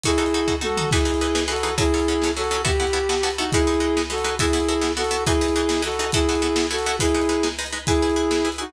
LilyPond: <<
  \new Staff \with { instrumentName = "Flute" } { \time 6/8 \key e \major \tempo 4. = 138 <e' gis'>2 <fis' a'>4 | <e' gis'>2 <fis' a'>4 | <e' gis'>2 <fis' a'>4 | g'2~ g'8 <dis' fis'>8 |
<e' gis'>2 <fis' a'>4 | <e' gis'>2 <fis' a'>4 | <e' gis'>2 <fis' a'>4 | <e' gis'>2 <fis' a'>4 |
<e' gis'>2 r4 | <e' gis'>2~ <e' gis'>8 <dis' fis'>8 | }
  \new Staff \with { instrumentName = "Pizzicato Strings" } { \time 6/8 \key e \major <dis' fis' a'>8 <dis' fis' a'>8 <dis' fis' a'>8 <dis' fis' a'>8 <dis' fis' a'>8 <dis' fis' a'>8 | <e dis' gis' b'>8 <e dis' gis' b'>8 <e dis' gis' b'>8 <e dis' gis' b'>8 <e dis' gis' b'>8 <e dis' gis' b'>8 | <fis cis' a'>8 <fis cis' a'>8 <fis cis' a'>8 <fis cis' a'>8 <fis cis' a'>8 <fis cis' a'>8 | <b e' fis' a'>8 <b e' fis' a'>8 <b e' fis' a'>8 <b e' fis' a'>8 <b e' fis' a'>8 <b e' fis' a'>8 |
<gis dis' b'>8 <gis dis' b'>8 <gis dis' b'>8 <gis dis' b'>8 <gis dis' b'>8 <gis dis' b'>8 | <b e' fis' a'>8 <b e' fis' a'>8 <b e' fis' a'>8 <b e' fis' a'>8 <b e' fis' a'>8 <b e' fis' a'>8 | <e dis' gis' b'>8 <e dis' gis' b'>8 <e dis' gis' b'>8 <e dis' gis' b'>8 <e dis' gis' b'>8 <e dis' gis' b'>8 | <b e' fis' a'>8 <b e' fis' a'>8 <b e' fis' a'>8 <b e' fis' a'>8 <b e' fis' a'>8 <b e' fis' a'>8 |
<gis dis' b'>8 <gis dis' b'>8 <gis dis' b'>8 <gis dis' b'>8 <gis dis' b'>8 <gis dis' b'>8 | <e' gis' b'>8 <e' gis' b'>8 <e' gis' b'>8 <e' gis' b'>8 <e' gis' b'>8 <e' gis' b'>8 | }
  \new DrumStaff \with { instrumentName = "Drums" } \drummode { \time 6/8 <hh bd>8. hh8. bd8 tommh8 toml8 | <cymc bd>8. hh8. sn8. hh8. | <hh bd>8. hh8. sn8. hh8. | <hh bd>8. hh8. sn8. hh8. |
<hh bd>8. hh8. sn8. hh8. | <hh bd>8. hh8. sn8. hh8. | <hh bd>8. hh8. sn8. hh8. | <hh bd>8. hh8. sn8. hh8. |
<hh bd>8. hh8. sn8. hh8. | <hh bd>8. hh8. sn8. hh8. | }
>>